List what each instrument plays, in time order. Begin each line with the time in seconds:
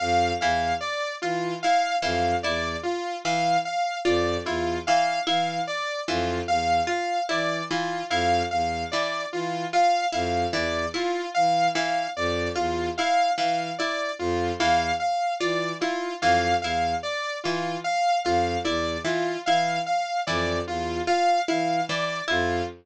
0.00 violin F2, lead 2 (sawtooth) F5
0.41 violin E2, pizzicato strings E3, lead 2 (sawtooth) F5
0.81 lead 2 (sawtooth) D5
1.22 violin E3, lead 2 (sawtooth) F4, pizzicato strings F4
1.63 pizzicato strings E4, lead 2 (sawtooth) F5
2.02 violin F2, pizzicato strings E3, lead 2 (sawtooth) F5
2.43 violin E2, pizzicato strings E4, lead 2 (sawtooth) D5
2.83 lead 2 (sawtooth) F4
3.24 violin E3, pizzicato strings E3, lead 2 (sawtooth) F5
3.65 lead 2 (sawtooth) F5
4.05 violin F2, pizzicato strings F4, lead 2 (sawtooth) D5
4.46 violin E2, pizzicato strings E4, lead 2 (sawtooth) F4
4.87 pizzicato strings E3, lead 2 (sawtooth) F5
5.27 violin E3, pizzicato strings E4, lead 2 (sawtooth) F5
5.67 lead 2 (sawtooth) D5
6.08 violin F2, pizzicato strings E3, lead 2 (sawtooth) F4
6.48 violin E2, lead 2 (sawtooth) F5
6.87 pizzicato strings F4, lead 2 (sawtooth) F5
7.29 violin E3, pizzicato strings E4, lead 2 (sawtooth) D5
7.71 pizzicato strings E3, lead 2 (sawtooth) F4
8.10 violin F2, pizzicato strings E4, lead 2 (sawtooth) F5
8.51 violin E2, lead 2 (sawtooth) F5
8.92 pizzicato strings E3, lead 2 (sawtooth) D5
9.33 violin E3, lead 2 (sawtooth) F4
9.73 pizzicato strings F4, lead 2 (sawtooth) F5
10.12 violin F2, pizzicato strings E4, lead 2 (sawtooth) F5
10.53 violin E2, pizzicato strings E3, lead 2 (sawtooth) D5
10.94 pizzicato strings E4, lead 2 (sawtooth) F4
11.34 violin E3, lead 2 (sawtooth) F5
11.75 pizzicato strings E3, lead 2 (sawtooth) F5
12.16 violin F2, lead 2 (sawtooth) D5
12.56 violin E2, pizzicato strings F4, lead 2 (sawtooth) F4
12.98 pizzicato strings E4, lead 2 (sawtooth) F5
13.38 violin E3, pizzicato strings E3, lead 2 (sawtooth) F5
13.78 pizzicato strings E4, lead 2 (sawtooth) D5
14.19 violin F2, lead 2 (sawtooth) F4
14.59 violin E2, pizzicato strings E3, lead 2 (sawtooth) F5
15.00 lead 2 (sawtooth) F5
15.40 violin E3, pizzicato strings F4, lead 2 (sawtooth) D5
15.81 pizzicato strings E4, lead 2 (sawtooth) F4
16.21 violin F2, pizzicato strings E3, lead 2 (sawtooth) F5
16.62 violin E2, pizzicato strings E4, lead 2 (sawtooth) F5
17.03 lead 2 (sawtooth) D5
17.44 violin E3, pizzicato strings E3, lead 2 (sawtooth) F4
17.84 lead 2 (sawtooth) F5
18.24 violin F2, pizzicato strings F4, lead 2 (sawtooth) F5
18.64 violin E2, pizzicato strings E4, lead 2 (sawtooth) D5
19.05 pizzicato strings E3, lead 2 (sawtooth) F4
19.46 violin E3, pizzicato strings E4, lead 2 (sawtooth) F5
19.86 lead 2 (sawtooth) F5
20.27 violin F2, pizzicato strings E3, lead 2 (sawtooth) D5
20.67 violin E2, lead 2 (sawtooth) F4
21.07 pizzicato strings F4, lead 2 (sawtooth) F5
21.48 violin E3, pizzicato strings E4, lead 2 (sawtooth) F5
21.89 pizzicato strings E3, lead 2 (sawtooth) D5
22.28 violin F2, pizzicato strings E4, lead 2 (sawtooth) F4